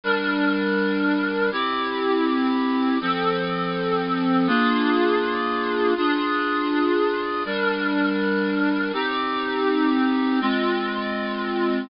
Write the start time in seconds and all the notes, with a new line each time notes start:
0.04 G3 D4 A#4
1.52 C4 E4 G4
3.01 F3 C4 A4
4.47 A#3 D4 F4 G#4
5.97 D4 F4 G#4
7.45 G3 D4 A#4
8.93 C4 D#4 G4
10.41 G#3 C4 F4